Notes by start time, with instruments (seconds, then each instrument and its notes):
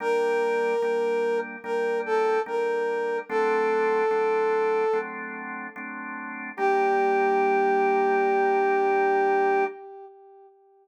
0.00 drawbar organ G3 A#3 D4, brass section A#4
0.82 drawbar organ G3 A#3 D4
1.64 drawbar organ G3 A#3 D4, brass section A#4
2.06 brass section A4
2.46 drawbar organ G3 A#3 D4, brass section A#4
3.29 drawbar organ F#3 A3 C4 D4, brass section A4
4.11 drawbar organ F#3 A3 C4 D4
4.93 drawbar organ F#3 A3 C4 D4
5.76 drawbar organ F#3 A3 C4 D4
6.57 drawbar organ G3 A#3 D4, brass section G4